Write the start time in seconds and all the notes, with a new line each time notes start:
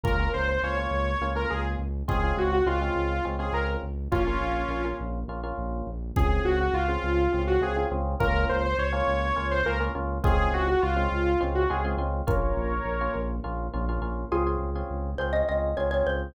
0.04 C#2 A#3 C#4 F4 A#4, kick
0.20 A#3 C#4 F4
0.33 C#2 C5
0.48 C5
0.63 C#2 A#3 C#4 F4 C#5
0.77 A#3 C#4 F4
0.91 C#2
1.21 C#2 A#3 C#4 F4
1.35 A#3 C#4 F4 A#4
1.50 C#2 G#4
1.79 C#2
2.08 C#2 G#3 C4 C#4 F4 G#4, kick
2.23 G#3 C4 C#4 F4
2.37 C#2 F#4
2.51 F#4
2.66 C#2 G#3 C4 C#4 F4
2.81 G#3 C4 C#4 F4
2.96 C#2
3.25 C#2 G#3 C4 C#4 F4
3.39 G#3 C4 C#4 F4 G#4
3.53 C#2 A#4
3.83 C#2
4.12 A#1 A#3 C#4 F4, kick
4.27 A#3 C#4 F4
4.40 A#1
4.69 A#1 A#3 C#4 F4
4.85 A#3 C#4 F4
5.00 A#1
5.28 A#1 A#3 C#4 F4
5.43 A#3 C#4 F4
5.58 A#1
5.87 A#1
6.16 C#2 C4 C#4 F4 G#4, kick
6.45 C#2 F#4
6.60 F#4
6.73 C#2 F4
6.88 C4 C#4 F4 G#4
7.03 C#2
7.32 C#2 C4 C#4 F4 G#4
7.47 F#4
7.61 C#2 C4 C#4 F4 G#4
7.76 C4 C#4 F4 G#4
7.91 C#2 C4 C#4 F4 G#4
8.20 C#2 A#3 C#4 F4 A#4, kick
8.49 C#2 C5
8.64 C5
8.78 C#2 C#5
8.92 A#3 C#4 F4
9.08 C#2
9.36 C#2 A#3 C#4 F4
9.51 C5
9.65 C#2 A#3 C#4 F4 A#4
9.80 A#3 C#4 F4
9.95 C#2 A#3 C#4 F4
10.24 C#2 G#3 C4 C#4 F4 G#4, kick
10.51 C#2 F#4
10.68 F#4
10.82 C#2 F4
10.96 G#3 C4 C#4 F4
11.12 C#2
11.41 C#2 G#3 C4 C#4 F4
11.55 F#4
11.70 C#2 G#3 C4 C#4 F4 G#4
11.84 G#3 C4 C#4 F4
11.97 C#2 G#3 C4 C#4 F4
12.27 A#1 A#3 C#4 F4 A#4 C#5, kick
12.56 A#1
12.85 A#1
13.01 A#3 C#4 F4
13.16 A#1
13.44 A#1 A#3 C#4 F4
13.74 A#1 A#3 C#4 F4
13.89 A#3 C#4 F4
14.01 A#1 A#3 C#4 F4
14.32 C#2 C4 C#4 F4 G#4
14.46 C4 C#4 F4 G#4
14.59 C#2
14.75 C4 C#4 F4 G#4
14.90 C#2
15.18 C#2 C4 C#4 F4 G#4 C5
15.33 C4 C#4 F4 G#4 D#5
15.48 C#2 C4 C#4 F4 G#4 D#5
15.77 C#2 C4 C#4 F4 G#4 C#5
15.91 C4 C#4 F4 G#4 C#5
16.07 C#2 C5